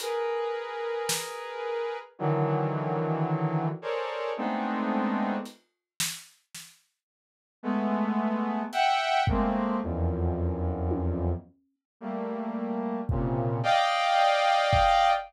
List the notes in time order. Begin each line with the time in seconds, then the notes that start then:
0.00 G#4 A#4 B4, closed hi-hat
1.09 snare
2.19 D3 D#3 E3 F#3
3.82 G#4 A4 A#4 C5 C#5 D5
4.37 G#3 A3 B3 C4 D4 D#4
5.45 closed hi-hat
6.00 snare
6.55 snare
7.63 G#3 A3 B3
8.72 E5 F#5 G5, closed hi-hat
9.27 G#3 A3 A#3 C4, kick
9.83 E2 F2 F#2
10.91 high tom
12.00 G3 A3 A#3
13.09 A#2 C3 C#3, kick
13.63 D5 D#5 F5 G5, cowbell
14.73 kick